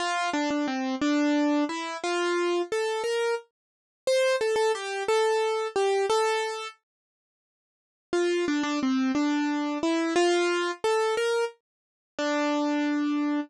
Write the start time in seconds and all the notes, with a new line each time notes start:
0.00 F4
0.33 D4
0.51 D4
0.68 C4
1.01 D4
1.69 E4
2.04 F4
2.72 A4
3.04 A#4
4.07 C5
4.41 A4
4.56 A4
4.75 G4
5.08 A4
5.76 G4
6.10 A4
8.13 F4
8.48 D4
8.63 D4
8.83 C4
9.15 D4
9.83 E4
10.16 F4
10.84 A4
11.17 A#4
12.19 D4